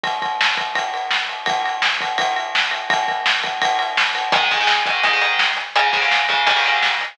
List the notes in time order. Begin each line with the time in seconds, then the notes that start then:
0.03 kick, ride
0.22 kick, ride
0.41 snare
0.57 kick, ride
0.75 kick, ride
0.94 ride
1.11 snare
1.29 ride
1.46 kick, ride
1.66 ride
1.82 snare
2.01 kick, ride
2.18 kick, ride
2.36 ride
2.55 snare
2.71 ride
2.90 kick, ride
3.08 kick, ride
3.26 snare
3.43 kick, ride
3.62 kick, ride
3.79 ride
3.97 snare
4.15 ride
4.32 G#2 D#3 G#3, kick, closed hi-hat
4.51 G#2 D#3 G#3, kick, closed hi-hat
4.60 G#2 D#3 G#3
4.67 snare
4.86 G#2 D#3 G#3, kick, closed hi-hat
5.03 G#2 D#3 G#3, kick, closed hi-hat
5.13 G#2 D#3 G#3
5.21 G#2 D#3 G#3, closed hi-hat
5.39 snare
5.57 closed hi-hat
5.76 G#2 C#3 G#3, closed hi-hat
5.93 G#2 C#3 G#3, kick, closed hi-hat
6.02 G#2 C#3 G#3
6.11 snare
6.29 G#2 C#3 G#3, kick, closed hi-hat
6.47 G#2 C#3 D#3 G3 A#3, kick, closed hi-hat
6.56 G#2 C#3 D#3 G3 A#3
6.64 G#2 C#3 D#3 G3 A#3, closed hi-hat
6.83 snare
7.01 closed hi-hat